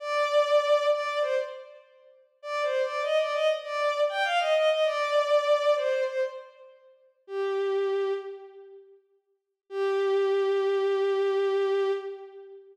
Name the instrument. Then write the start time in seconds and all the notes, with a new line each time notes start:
violin
0.00 D5
0.91 D5
1.21 C5
2.42 D5
2.63 C5
2.83 D5
3.03 D#5
3.18 D5
3.33 D#5
3.64 D5
4.09 G5
4.24 F5
4.39 D#5
4.55 D#5
4.70 D#5
4.85 D5
5.76 C5
6.06 C5
7.27 G4
9.70 G4